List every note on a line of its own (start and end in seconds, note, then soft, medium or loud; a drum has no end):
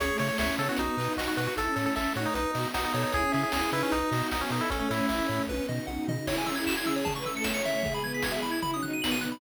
0.00 0.11 C#2 medium
0.00 0.09 C#4 medium
0.00 0.78 C#4 medium
0.00 0.78 E4 medium
0.00 0.78 G#4 medium
0.00 0.18 G#4 medium
0.00 0.17 C#5 loud
0.00 kick loud
0.00 closed hi-hat loud
0.09 0.45 A3 medium
0.18 0.31 C#3 medium
0.18 0.28 C#5 loud
0.18 0.37 C#5 medium
0.18 open hi-hat medium
0.29 0.38 C#5 loud
0.38 0.50 C#2 medium
0.38 0.56 C#5 loud
0.38 0.57 E5 medium
0.38 kick medium
0.38 snare loud
0.57 0.69 C#3 medium
0.57 0.94 B3 medium
0.57 0.68 A4 loud
0.57 0.77 C#5 medium
0.57 open hi-hat medium
0.69 0.78 F#4 medium
0.77 0.89 B1 medium
0.77 1.56 B3 medium
0.77 1.56 D#4 medium
0.77 1.13 D#4 medium
0.77 1.56 F#4 medium
0.77 0.96 F#4 medium
0.77 kick medium
0.77 closed hi-hat loud
0.97 1.08 B2 medium
0.97 1.33 D#4 medium
0.97 1.16 B4 medium
0.97 open hi-hat medium
1.17 1.28 B1 medium
1.17 1.27 F#4 medium
1.17 1.35 D#5 medium
1.17 kick medium
1.17 snare loud
1.28 1.37 F#4 medium
1.37 1.48 B2 medium
1.37 1.56 F#4 medium
1.37 1.47 F#4 loud
1.37 1.55 B4 medium
1.37 open hi-hat medium
1.47 1.56 F#4 medium
1.57 1.68 A1 medium
1.57 2.35 A3 medium
1.57 2.35 C#4 medium
1.57 2.35 E4 medium
1.57 1.67 E4 medium
1.57 1.75 A4 medium
1.57 1.75 A4 loud
1.57 kick medium
1.57 closed hi-hat loud
1.67 2.04 C#4 medium
1.76 1.87 A2 medium
1.76 1.85 A4 medium
1.76 1.93 C#5 medium
1.76 open hi-hat medium
1.86 1.95 A4 medium
1.96 2.07 A1 medium
1.96 2.13 A4 medium
1.96 2.13 E5 medium
1.96 kick medium
1.96 clap loud
2.14 2.27 A2 medium
2.14 2.48 D#4 medium
2.14 2.26 F#4 medium
2.14 2.34 C#5 medium
2.14 open hi-hat medium
2.26 2.35 D#4 loud
2.34 2.46 B1 medium
2.34 3.13 B3 medium
2.34 2.68 D#4 loud
2.34 3.13 D#4 medium
2.34 3.13 F#4 medium
2.34 2.51 B4 medium
2.34 kick medium
2.34 closed hi-hat loud
2.54 2.66 B2 medium
2.54 2.92 F#4 medium
2.54 2.72 D#5 medium
2.54 open hi-hat medium
2.74 2.86 B1 medium
2.74 2.84 D#4 loud
2.74 2.92 F#5 medium
2.74 kick medium
2.74 snare loud
2.85 2.93 D#4 loud
2.94 3.05 B2 medium
2.94 3.03 D#4 medium
2.94 3.11 A4 medium
2.94 3.32 C#5 medium
2.94 open hi-hat medium
3.03 3.12 D#4 medium
3.12 3.25 C#2 medium
3.12 3.92 C#4 medium
3.12 3.23 E4 medium
3.12 3.92 E4 medium
3.12 3.32 G#4 loud
3.12 3.92 G#4 medium
3.12 kick loud
3.12 closed hi-hat medium
3.23 3.61 C#4 medium
3.32 3.45 C#3 medium
3.32 3.43 G#4 medium
3.32 3.50 E5 medium
3.32 open hi-hat medium
3.43 3.53 G#4 medium
3.52 3.64 C#2 medium
3.52 3.71 G#4 medium
3.52 3.71 G#5 medium
3.52 kick medium
3.52 snare loud
3.72 3.83 C#3 medium
3.72 4.05 D#4 medium
3.72 3.82 E4 loud
3.72 4.10 B4 medium
3.72 open hi-hat medium
3.83 3.92 C#4 loud
3.92 4.03 B1 medium
3.92 4.70 B3 medium
3.92 4.28 D#4 loud
3.92 4.70 D#4 medium
3.92 4.70 F#4 medium
3.92 kick medium
3.92 closed hi-hat loud
4.11 4.22 B2 medium
4.11 4.43 F#4 medium
4.11 4.29 D#5 medium
4.11 open hi-hat medium
4.31 4.43 B1 medium
4.31 4.41 D#4 loud
4.31 4.49 F#5 medium
4.31 kick medium
4.31 snare loud
4.41 4.50 C#4 loud
4.50 4.61 B2 medium
4.50 4.61 D#4 medium
4.50 4.66 A4 medium
4.50 4.68 D#5 medium
4.50 open hi-hat medium
4.61 4.70 E4 medium
4.70 4.82 A1 medium
4.70 5.48 A3 medium
4.70 5.10 A3 medium
4.70 5.48 C#4 medium
4.70 4.79 C#4 loud
4.70 5.10 C#4 medium
4.70 5.48 E4 medium
4.70 4.89 A4 medium
4.70 kick loud
4.70 closed hi-hat loud
4.79 4.89 C#4 loud
4.89 5.01 A2 medium
4.89 5.43 E4 medium
4.89 5.06 C#5 medium
4.89 open hi-hat medium
5.09 5.21 A1 medium
5.09 5.19 E4 medium
5.09 5.27 E5 medium
5.09 kick medium
5.09 clap loud
5.19 5.62 C#4 medium
5.28 5.40 A2 medium
5.28 5.46 C#5 medium
5.28 open hi-hat medium
5.47 5.60 B1 medium
5.47 6.27 B3 medium
5.47 6.27 D#4 medium
5.47 6.27 F#4 medium
5.47 5.67 B4 medium
5.47 kick medium
5.47 high tom medium
5.69 5.80 B2 medium
5.69 5.86 D#5 medium
5.69 floor tom medium
5.87 5.98 B1 medium
5.87 6.05 F#5 medium
5.87 high tom medium
6.08 6.19 B2 medium
6.08 6.26 D#5 medium
6.08 floor tom loud
6.27 7.05 C#4 medium
6.27 7.05 E4 medium
6.27 6.46 E4 medium
6.27 7.05 G#4 medium
6.27 6.36 C#5 loud
6.27 kick loud
6.27 crash loud
6.38 6.47 G#5 medium
6.46 6.56 C#4 medium
6.46 6.55 E6 medium
6.46 floor tom medium
6.56 6.66 E4 medium
6.56 6.64 G#6 medium
6.66 6.75 F#4 medium
6.66 6.76 E7 medium
6.66 kick medium
6.66 clap loud
6.77 6.87 E4 loud
6.77 6.86 G#6 medium
6.86 7.11 G#4 medium
6.86 6.95 E6 medium
6.86 floor tom medium
6.96 7.05 C#5 medium
7.05 7.83 A3 medium
7.05 7.83 C#4 medium
7.05 7.83 E4 medium
7.05 7.14 A5 loud
7.05 kick loud
7.05 floor tom loud
7.16 7.25 B4 medium
7.16 7.24 C#6 medium
7.25 7.34 A4 medium
7.25 7.35 E6 medium
7.25 floor tom medium
7.34 7.43 A4 medium
7.34 7.46 C#7 medium
7.44 7.80 C#5 loud
7.44 7.53 E7 medium
7.44 kick loud
7.44 snare loud
7.54 7.63 C#7 medium
7.65 7.94 E5 loud
7.65 floor tom medium
7.83 8.62 E3 medium
7.83 8.62 G#3 medium
7.83 8.62 B3 medium
7.83 7.99 G#4 medium
7.83 kick loud
7.83 floor tom loud
7.94 8.03 B5 medium
8.03 8.13 B4 medium
8.03 8.13 G#6 medium
8.03 floor tom medium
8.14 8.23 G#4 medium
8.14 8.23 B6 medium
8.22 8.32 F#4 medium
8.22 8.33 G#6 medium
8.22 kick loud
8.22 snare loud
8.32 8.43 G#4 loud
8.32 8.41 E5 medium
8.41 8.73 E4 medium
8.41 8.51 B5 medium
8.41 floor tom medium
8.51 8.60 G#6 medium
8.62 9.40 B2 loud
8.62 9.40 F#3 medium
8.62 9.40 D#4 medium
8.62 8.71 B5 loud
8.62 kick medium
8.62 floor tom loud
8.74 8.83 C#4 medium
8.74 8.82 D#6 medium
8.83 8.91 D#4 medium
8.83 8.91 F#6 medium
8.83 floor tom medium
8.92 9.01 D#4 medium
8.92 9.02 D#7 medium
9.01 9.35 B3 medium
9.01 9.11 F#7 medium
9.01 kick medium
9.01 snare loud
9.11 9.20 D#7 medium
9.21 9.30 F#6 medium
9.21 floor tom medium
9.32 9.40 B5 medium